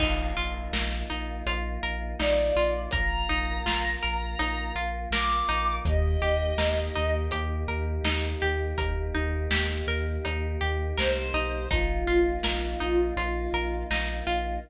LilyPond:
<<
  \new Staff \with { instrumentName = "Violin" } { \time 4/4 \key bes \major \tempo 4 = 82 r2. d''4 | bes''2. d'''4 | ees''2 r2 | r2. c''4 |
f'2 f'4 r4 | }
  \new Staff \with { instrumentName = "Pizzicato Strings" } { \time 4/4 \key bes \major ees'8 f'8 bes'8 ees'8 f'8 bes'8 ees'8 f'8 | bes'8 ees'8 f'8 bes'8 ees'8 f'8 bes'8 ees'8~ | ees'8 g'8 bes'8 ees'8 g'8 bes'8 ees'8 g'8 | bes'8 ees'8 g'8 bes'8 ees'8 g'8 bes'8 ees'8 |
ees'8 f'8 bes'8 ees'8 f'8 bes'8 ees'8 f'8 | }
  \new Staff \with { instrumentName = "Synth Bass 2" } { \clef bass \time 4/4 \key bes \major bes,,8 bes,,8 bes,,8 bes,,8 bes,,8 bes,,8 bes,,8 bes,,8 | bes,,8 bes,,8 bes,,8 bes,,8 bes,,8 bes,,8 bes,,8 bes,,8 | ees,8 ees,8 ees,8 ees,8 ees,8 ees,8 ees,8 ees,8 | ees,8 ees,8 ees,8 ees,8 ees,8 ees,8 c,8 b,,8 |
bes,,8 bes,,8 bes,,8 bes,,8 bes,,8 bes,,8 bes,,8 bes,,8 | }
  \new Staff \with { instrumentName = "Choir Aahs" } { \time 4/4 \key bes \major <bes ees' f'>1 | <bes f' bes'>1 | <bes ees' g'>1~ | <bes ees' g'>1 |
<bes ees' f'>1 | }
  \new DrumStaff \with { instrumentName = "Drums" } \drummode { \time 4/4 <cymc bd>4 sn4 hh4 sn4 | <hh bd>4 sn4 hh4 sn4 | <hh bd>4 sn4 hh4 sn4 | <hh bd>4 sn4 hh4 sn4 |
<hh bd>4 sn4 hh4 sn4 | }
>>